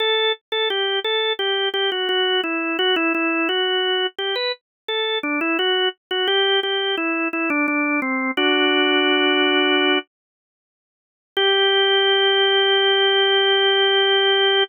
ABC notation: X:1
M:4/4
L:1/16
Q:1/4=86
K:G
V:1 name="Drawbar Organ"
A2 z A G2 A2 G2 G F F2 E2 | F E E2 F4 G B z2 A2 D E | F2 z F G2 G2 E2 E D D2 C2 | "^rit." [DF]10 z6 |
G16 |]